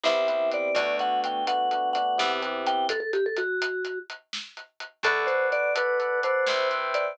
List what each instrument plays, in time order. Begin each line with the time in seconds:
0.03 electric bass (finger) C2, electric piano 1 B3 C4 E4 G4, vibraphone E5, snare
0.27 electric piano 1 B3 C4 E4 G4, closed hi-hat
0.51 vibraphone D5, closed hi-hat
0.75 electric bass (finger) D2, electric piano 1 A3 B3 D4 F#4, vibraphone D5, kick, closed hi-hat
0.99 vibraphone F#5, closed hi-hat
1.24 vibraphone G5, closed hi-hat
1.47 electric piano 1 A3 B3 D4 F#4, vibraphone F#5, closed hi-hat
1.71 electric piano 1 A3 B3 D4 F#4, closed hi-hat
1.93 electric piano 1 A3 B3 D4 F#4, vibraphone F#5, closed hi-hat
2.18 electric bass (finger) E2, electric piano 1 B3 C4 E4 G4, snare
2.42 electric piano 1 B3 C4 E4 G4, closed hi-hat
2.66 vibraphone G5, closed hi-hat
2.89 vibraphone A4, kick, closed hi-hat
3.00 vibraphone A4
3.13 vibraphone G4, closed hi-hat
3.26 vibraphone A4
3.37 vibraphone F#4, closed hi-hat
3.62 closed hi-hat
3.85 closed hi-hat
4.10 closed hi-hat
4.33 snare
4.57 closed hi-hat
4.80 closed hi-hat
5.03 electric bass (finger) D2, electric piano 1 A4 B4 D5 F#5, vibraphone A4, kick, closed hi-hat
5.27 vibraphone C5, closed hi-hat
5.52 vibraphone D5, closed hi-hat
5.75 electric piano 1 A4 B4 D5 F#5, vibraphone B4, closed hi-hat
5.99 electric piano 1 A4 B4 D5 F#5, closed hi-hat
6.23 electric piano 1 A4 B4 D5 F#5, vibraphone C5, closed hi-hat
6.47 electric bass (finger) C2, electric piano 1 B4 C5 E5 G5, snare
6.71 electric piano 1 B4 C5 E5 G5, closed hi-hat
6.94 vibraphone D5, closed hi-hat